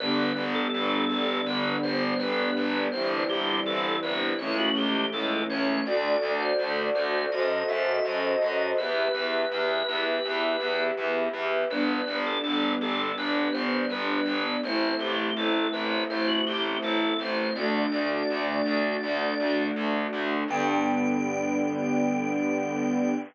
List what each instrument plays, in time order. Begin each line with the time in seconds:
0.00 electric bass (finger) G1, string ensemble 1 D3 G3 B3, drawbar organ B4
0.36 electric bass (finger) G1
0.55 drawbar organ A4
0.74 electric bass (finger) G1
1.09 electric bass (finger) G1, drawbar organ A4
1.46 electric bass (finger) G1, drawbar organ B4
1.82 electric bass (finger) G1, drawbar organ C5
2.18 electric bass (finger) G1, drawbar organ B4
2.57 electric bass (finger) G1
2.92 electric bass (finger) G1, string ensemble 1 E3 G3 C4, drawbar organ C5
3.29 electric bass (finger) G1, drawbar organ G4
3.66 electric bass (finger) G1, drawbar organ A4
4.03 electric bass (finger) G1, drawbar organ B4
4.38 electric bass (finger) C#2, string ensemble 1 E3 A3 C#4, drawbar organ C#5
4.57 drawbar organ F#4
4.75 electric bass (finger) C#2, drawbar organ G4
5.12 electric bass (finger) C#2, drawbar organ A4
5.50 electric bass (finger) C#2, drawbar organ C#5
5.85 electric bass (finger) D2, string ensemble 1 F#4 A4 D5, drawbar organ D5
6.22 electric bass (finger) D2
6.39 drawbar organ C5
6.59 electric bass (finger) D2
6.95 electric bass (finger) D2, drawbar organ C5
7.32 electric bass (finger) F#2, string ensemble 1 F#4 A4 C5 D#5, drawbar organ D#5
7.68 electric bass (finger) F#2, drawbar organ E5
8.05 electric bass (finger) F#2, drawbar organ D#5
8.42 electric bass (finger) F#2
8.77 electric bass (finger) E2, string ensemble 1 G4 B4 E5, drawbar organ B4
9.14 electric bass (finger) E2
9.51 electric bass (finger) E2
9.88 electric bass (finger) E2
10.25 electric bass (finger) E2
10.60 electric bass (finger) E2
10.97 electric bass (finger) E2
11.34 electric bass (finger) E2
11.70 electric bass (finger) G1, string ensemble 1 G3 B3 D4, drawbar organ B4
12.07 electric bass (finger) G1
12.27 drawbar organ A4
12.44 electric bass (finger) G1
12.81 electric bass (finger) G1, drawbar organ A4
13.18 electric bass (finger) G1, drawbar organ B4
13.52 electric bass (finger) G1, drawbar organ C5
13.90 electric bass (finger) G1, drawbar organ B4
14.26 electric bass (finger) G1
14.63 electric bass (finger) A1, string ensemble 1 A3 C4 E4, drawbar organ C5
14.99 electric bass (finger) A1, drawbar organ G4
15.36 electric bass (finger) A1, drawbar organ A4
15.73 electric bass (finger) A1, drawbar organ B4
16.10 electric bass (finger) A1, drawbar organ C5
16.27 drawbar organ F#4
16.46 electric bass (finger) A1, drawbar organ G4
16.82 electric bass (finger) A1, drawbar organ A4
17.19 electric bass (finger) A1, drawbar organ C5
17.55 electric bass (finger) D2, string ensemble 1 A3 D4 F#4, drawbar organ D5
17.92 electric bass (finger) D2
18.30 electric bass (finger) D2
18.66 electric bass (finger) D2
19.03 electric bass (finger) D2
19.40 electric bass (finger) D2
19.76 electric bass (finger) D2
20.13 electric bass (finger) D2
20.48 electric bass (finger) G2, string ensemble 1 D3 G3 B3, drawbar organ G5